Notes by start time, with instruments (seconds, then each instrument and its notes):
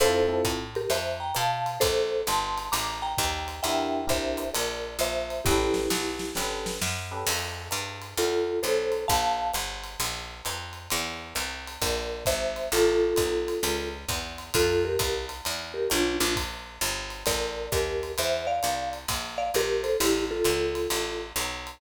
0.00 electric bass (finger) F2, electric piano 1 C4 E4 F4 A4, marimba A4 C5, ride
0.28 electric piano 1 C4 E4 F4 A4
0.45 electric bass (finger) A2, kick, hi-hat pedal, ride
0.75 marimba G4 A#4, ride
0.90 electric bass (finger) F2, marimba C5 E5, ride
1.20 marimba G5 A#5
1.35 electric bass (finger) B2, marimba F5 A5, hi-hat pedal, ride
1.66 ride
1.80 electric bass (finger) A#1, marimba A4 C5, kick, ride
2.27 electric bass (finger) G1, marimba A5 C6, hi-hat pedal, ride
2.58 ride
2.72 electric bass (finger) A1, marimba A#5 D6, ride
3.02 marimba G5 A#5
3.18 electric bass (finger) D#2, kick, hi-hat pedal, ride
3.48 ride
3.63 electric bass (finger) E2, electric piano 1 D4 E4 G4 A#4, marimba E5 G5, ride
4.07 electric bass (finger) C2, electric piano 1 D4 E4 G4 A#4, marimba C5 E5, kick, ride
4.37 hi-hat pedal, ride
4.54 electric bass (finger) A#1, marimba A#4 D5, ride
4.99 electric bass (finger) A#1, marimba C5 E5, hi-hat pedal, ride
5.30 ride
5.44 electric bass (finger) A1, electric piano 1 C#4 G4 A4 B4, marimba E4 G4, kick, snare
5.74 snare
5.90 electric bass (finger) B1, snare
6.19 snare
6.35 electric bass (finger) G1, electric piano 1 C#4 G4 A4 B4, snare
6.66 snare
6.81 electric bass (finger) F#2, snare
7.11 electric piano 1 C#4 G4 A4 B4
7.27 electric bass (finger) F2, crash, ride
7.71 electric bass (finger) G2, hi-hat pedal, ride
8.02 ride
8.17 electric bass (finger) E2, marimba F4 A4, ride
8.63 electric bass (finger) B1, marimba A4 C5, hi-hat pedal, ride
8.92 ride
9.08 electric bass (finger) A#1, marimba F5 A5, kick, ride
9.54 electric bass (finger) G1, hi-hat pedal, ride
9.84 ride
10.00 electric bass (finger) A#1, ride
10.45 electric bass (finger) F2, hi-hat pedal, ride
10.73 ride
10.90 electric bass (finger) E2, ride
11.35 electric bass (finger) C2, hi-hat pedal, ride
11.67 ride
11.82 electric bass (finger) A#1, marimba A#4 D5, kick, ride
12.25 electric bass (finger) G#1, marimba C5 E5, kick, hi-hat pedal, ride
12.56 ride
12.72 electric bass (finger) A1, marimba F4 A4, ride
13.16 electric bass (finger) B1, kick, hi-hat pedal, ride
13.48 ride
13.63 electric bass (finger) C#2, ride
14.09 electric bass (finger) E2, kick, hi-hat pedal, ride
14.38 ride
14.54 electric bass (finger) F2, marimba F4 A4, kick, ride
14.85 marimba G4 A#4
14.99 electric bass (finger) C2, kick, hi-hat pedal, ride
15.29 ride
15.45 electric bass (finger) E2, ride
15.74 marimba G4 A#4
15.90 electric bass (finger) B1, marimba D4 F4, hi-hat pedal, ride
16.20 electric bass (finger) A#1, marimba D4 F4, ride
16.36 kick, ride
16.81 electric bass (finger) G1, hi-hat pedal, ride
17.10 ride
17.26 electric bass (finger) A1, marimba A#4 D5, kick, ride
17.72 electric bass (finger) D#2, marimba G4 A#4, kick, hi-hat pedal, ride
18.03 ride
18.18 electric bass (finger) E2, marimba C5 E5, ride
18.47 marimba D5 F5
18.63 electric bass (finger) C2, hi-hat pedal, ride
18.93 ride
19.08 electric bass (finger) A#1, kick, ride
19.38 marimba D5 F5
19.54 electric bass (finger) A#1, marimba G4 A#4, hi-hat pedal, ride
19.83 marimba A4 C5, ride
20.00 electric bass (finger) A1, marimba E4 G4, ride
20.31 marimba F4 A4
20.45 electric bass (finger) C#2, hi-hat pedal, ride
20.75 ride
20.90 electric bass (finger) A1, ride
21.36 electric bass (finger) B1, hi-hat pedal, ride
21.67 ride